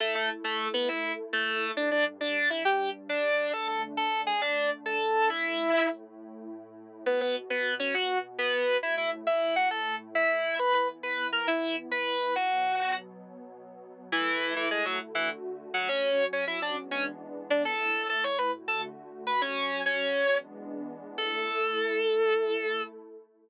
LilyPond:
<<
  \new Staff \with { instrumentName = "Distortion Guitar" } { \time 12/8 \key a \major \tempo 4. = 136 <a a'>8 <a a'>8 r8 <a a'>4 <b b'>8 <e' e''>4 r8 <a a'>4. | <d' d''>8 <d' d''>8 r8 <d' d''>4 <e' e''>8 <g' g''>4 r8 <d' d''>4. | <a' a''>8 <a' a''>8 r8 <a' a''>4 <gis' gis''>8 <d' d''>4 r8 <a' a''>4. | <e' e''>2~ <e' e''>8 r2. r8 |
\key b \major <b b'>8 <b b'>8 r8 <b b'>4 <cis' cis''>8 <fis' fis''>4 r8 <b b'>4. | <e' e''>8 <e' e''>8 r8 <e' e''>4 <fis' fis''>8 <a' a''>4 r8 <e' e''>4. | <b' b''>8 <b' b''>8 r8 <b' b''>4 <ais' ais''>8 <e' e''>4 r8 <b' b''>4. | <fis' fis''>2~ <fis' fis''>8 r2. r8 |
\key a \major <e e'>4. <e e'>8 <gis gis'>8 <fis fis'>8 r8 <e e'>8 r4. <fis fis'>8 | <cis' cis''>4. <cis' cis''>8 <e' e''>8 <d' d''>8 r8 <cis' cis''>8 r4. <d' d''>8 | <a' a''>4. <a' a''>8 <cis'' cis'''>8 <b' b''>8 r8 <a' a''>8 r4. <b' b''>8 | <cis' cis''>4. <cis' cis''>2 r2 r8 |
a'1. | }
  \new Staff \with { instrumentName = "Pad 2 (warm)" } { \time 12/8 \key a \major <a e' a'>1. | <g, g d'>1. | <d a d'>1. | <a, a e'>1. |
\key b \major <b, b fis'>1. | <a, a e'>1. | <e b e'>1. | <b, fis b>1. |
\key a \major <a e' a'>2. <d a fis'>2. | <fis cis' fis'>2. <e gis b d'>2. | <a, a e'>2. <d a fis'>2. | <fis cis' fis'>2. <e gis b d'>2. |
<a e' a'>1. | }
>>